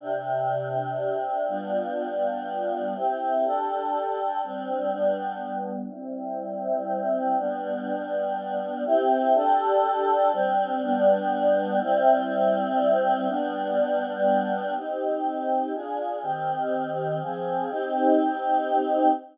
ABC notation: X:1
M:3/4
L:1/8
Q:1/4=122
K:C
V:1 name="Choir Aahs"
[C,DG]6 | [G,B,DF]6 | [CEG]2 [DGA]4 | [G,CD]2 [G,B,D]4 |
[G,CE]6 | [G,B,D]6 | [CEG]2 [DGA]4 | [G,CD]2 [G,B,D]4 |
[G,CE]6 | [G,B,D]6 | [K:Cm] [CEG]4 [DFA]2 | [E,CG]4 [F,CA]2 |
[CEG]6 |]